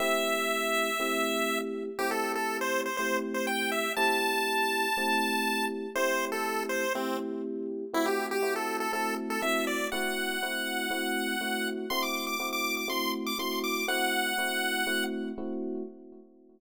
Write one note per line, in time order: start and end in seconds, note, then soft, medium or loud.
0.00 0.89 A3 loud
0.00 0.89 C4 loud
0.00 0.89 E4 loud
0.00 0.89 G4 loud
0.00 1.59 E5 medium
1.00 1.89 A3 medium
1.00 1.89 C4 loud
1.00 1.89 E4 medium
1.00 1.89 G4 loud
1.99 2.88 A3 loud
1.99 2.88 C4 loud
1.99 2.88 E4 loud
1.99 2.10 G4 medium
1.99 2.88 G4 loud
2.11 2.32 A4 medium
2.35 2.57 A4 medium
2.61 2.81 C5 medium
2.86 2.97 C5 medium
2.97 3.88 A3 loud
2.97 3.88 C4 medium
2.97 3.88 E4 medium
2.97 3.88 G4 medium
2.97 3.17 C5 medium
3.34 3.46 C5 medium
3.47 3.71 G5 medium
3.72 3.93 E5 medium
3.96 4.86 A3 loud
3.96 4.86 C4 loud
3.96 4.86 E4 loud
3.96 4.86 G4 loud
3.96 5.66 A5 medium
4.97 5.86 A3 loud
4.97 5.86 C4 loud
4.97 5.86 E4 loud
4.97 5.86 G4 medium
5.95 6.85 A3 loud
5.95 6.85 C4 loud
5.95 6.85 E4 loud
5.95 6.85 G4 loud
5.95 6.25 C5 medium
6.32 6.64 A4 medium
6.69 6.93 C5 medium
6.95 7.84 A3 medium
6.95 7.84 C4 loud
6.95 7.17 C4 medium
6.95 7.84 E4 loud
6.95 7.84 G4 medium
7.93 8.38 A3 loud
7.93 8.38 C4 loud
7.93 8.38 E4 loud
7.93 8.06 E4 medium
7.93 8.38 F#4 loud
8.06 8.27 G4 medium
8.31 8.54 G4 medium
8.42 8.87 A3 loud
8.42 8.87 C4 medium
8.42 8.87 E4 medium
8.42 8.87 F#4 loud
8.56 8.77 A4 medium
8.80 8.92 A4 medium
8.93 9.38 A3 loud
8.93 9.38 C4 medium
8.93 9.38 E4 medium
8.93 9.38 F#4 medium
8.93 9.15 A4 medium
9.30 9.42 A4 medium
9.42 9.87 A3 medium
9.42 9.87 C4 loud
9.42 9.87 E4 loud
9.42 9.87 F#4 loud
9.42 9.65 E5 medium
9.67 9.88 D5 medium
9.92 10.37 A3 loud
9.92 10.37 C4 loud
9.92 10.37 E4 loud
9.92 10.37 F#4 loud
9.92 11.68 F#5 medium
10.42 10.87 A3 loud
10.42 10.87 C4 loud
10.42 10.87 E4 loud
10.42 10.87 F#4 medium
10.90 11.35 A3 loud
10.90 11.35 C4 loud
10.90 11.35 E4 loud
10.90 11.35 F#4 loud
11.41 11.85 A3 loud
11.41 11.85 C4 medium
11.41 11.85 E4 medium
11.41 11.85 F#4 loud
11.90 12.35 A3 loud
11.90 12.35 C4 loud
11.90 12.35 E4 loud
11.90 12.35 F#4 loud
11.90 12.02 C6 medium
12.03 12.26 D6 medium
12.27 12.49 D6 medium
12.40 12.84 A3 medium
12.40 12.84 C4 medium
12.40 12.84 E4 loud
12.40 12.84 F#4 medium
12.53 12.76 D6 medium
12.77 12.89 D6 medium
12.88 13.33 A3 loud
12.88 13.33 C4 loud
12.88 13.33 E4 loud
12.88 13.33 F#4 medium
12.88 13.12 C6 medium
13.26 13.38 D6 medium
13.39 13.83 A3 loud
13.39 13.83 C4 medium
13.39 13.83 E4 loud
13.39 13.83 F#4 loud
13.39 13.60 C6 medium
13.64 13.86 D6 medium
13.88 14.33 A3 loud
13.88 14.33 C4 loud
13.88 14.33 E4 loud
13.88 14.33 F#4 loud
13.88 15.04 F#5 loud
14.38 14.83 A3 loud
14.38 14.83 C4 medium
14.38 14.83 E4 loud
14.38 14.83 F#4 medium
14.87 15.31 A3 loud
14.87 15.31 C4 loud
14.87 15.31 E4 loud
14.87 15.31 F#4 loud
15.38 15.82 A3 loud
15.38 15.82 C4 loud
15.38 15.82 E4 loud
15.38 15.82 F#4 loud